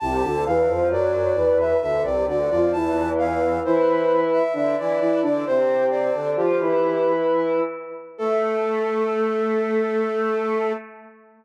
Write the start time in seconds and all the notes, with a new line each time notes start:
0.00 C2 C3 A5
0.23 D2 D3
0.46 E2 E3 F5
0.68 F2 F3
0.89 F#2 F#3 D5
1.35 E2 E3
1.60 E5
1.81 D2 D3 E5
2.03 C2 C3 D5
2.27 D2 D3 D5
2.50 F2 F3 D5
2.72 E2 E3 A5
3.18 F5
3.64 E3 E4 C5
4.33 E5
4.53 D3 D4 E5
4.78 E3 E4 D5
5.00 E3 E4 D5
5.22 D3 D4 D5
5.46 C3 C4 C5
5.90 D5
6.14 D3 D4
6.36 F3 F4 G4
6.60 E3 E4
8.18 A3 A4